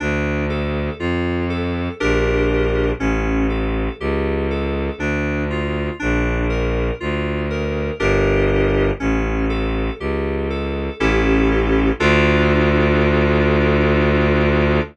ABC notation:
X:1
M:3/4
L:1/8
Q:1/4=60
K:Dm
V:1 name="Electric Piano 2"
D A F A [DGB]2 | ^C A G A D F | D B F B [DGB]2 | ^C A G A [CEGA]2 |
[DFA]6 |]
V:2 name="Violin" clef=bass
D,,2 F,,2 B,,,2 | A,,,2 ^C,,2 D,,2 | B,,,2 D,,2 G,,,2 | A,,,2 ^C,,2 A,,,2 |
D,,6 |]